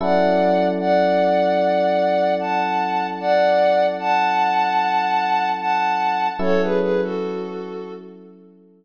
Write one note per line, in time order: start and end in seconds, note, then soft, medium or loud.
0.01 6.29 F#3 medium
0.01 6.29 C#4 medium
0.01 6.29 E4 medium
0.01 6.29 A4 medium
0.01 0.67 D5 medium
0.01 0.67 F#5 medium
0.80 2.34 D5 medium
0.80 2.34 F#5 medium
2.40 3.07 F#5 medium
2.40 3.07 A5 medium
3.20 3.86 D5 medium
3.20 3.86 F#5 medium
4.00 5.50 F#5 medium
4.00 5.50 A5 medium
5.60 6.28 F#5 medium
5.60 6.28 A5 medium
6.39 8.85 F#3 medium
6.39 8.85 C#4 medium
6.39 8.85 E4 medium
6.39 8.85 A4 medium
6.39 6.62 A4 medium
6.39 6.62 C#5 medium
6.62 6.79 G#4 medium
6.62 6.79 B4 medium
6.80 7.01 G#4 medium
6.80 7.01 B4 medium
7.02 7.94 F#4 medium
7.02 7.94 A4 medium